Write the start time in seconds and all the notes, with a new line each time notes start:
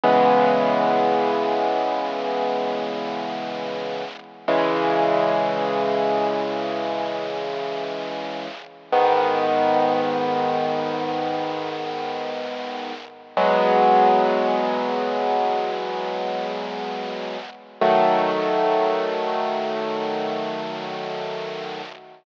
0.03 C#3 E3 G#3 B3
4.48 C#3 E3 G#3
8.92 G#2 D#3 B3
13.37 E2 F#3 G#3 B3
17.81 D#3 F#3 A3